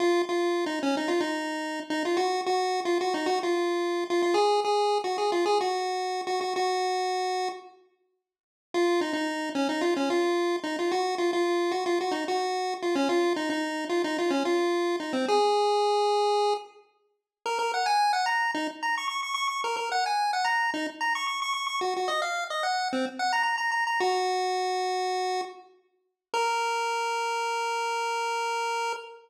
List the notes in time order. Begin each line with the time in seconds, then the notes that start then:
0.00 F4
0.29 F4
0.66 D#4
0.83 C#4
0.97 D#4
1.08 F4
1.20 D#4
1.90 D#4
2.05 F4
2.17 F#4
2.46 F#4
2.85 F4
3.01 F#4
3.14 D#4
3.26 F#4
3.43 F4
4.10 F4
4.22 F4
4.34 G#4
4.65 G#4
5.04 F#4
5.18 G#4
5.32 F4
5.46 G#4
5.61 F#4
6.27 F#4
6.41 F#4
6.56 F#4
8.74 F4
9.01 D#4
9.13 D#4
9.55 C#4
9.69 D#4
9.81 F4
9.96 C#4
10.10 F4
10.64 D#4
10.79 F4
10.91 F#4
11.18 F4
11.33 F4
11.71 F#4
11.86 F4
12.01 F#4
12.11 D#4
12.28 F#4
12.82 F4
12.95 C#4
13.09 F4
13.36 D#4
13.50 D#4
13.89 F4
14.04 D#4
14.18 F4
14.30 C#4
14.45 F4
15.00 D#4
15.13 C4
15.28 G#4
17.46 A#4
17.59 A#4
17.74 F#5
17.86 G#5
18.13 F#5
18.26 A#5
18.54 D#4
18.83 A#5
18.98 C#6
19.08 C#6
19.23 C#6
19.34 C#6
19.48 C#6
19.64 A#4
19.77 A#4
19.92 F#5
20.06 G#5
20.33 F#5
20.45 A#5
20.74 D#4
21.01 A#5
21.15 C#6
21.27 C#6
21.42 C#6
21.54 C#6
21.67 C#6
21.81 F#4
21.96 F#4
22.08 D#5
22.22 F5
22.50 D#5
22.63 F#5
22.93 C4
23.19 F#5
23.33 A#5
23.43 A#5
23.58 A#5
23.72 A#5
23.87 A#5
24.00 F#4
26.34 A#4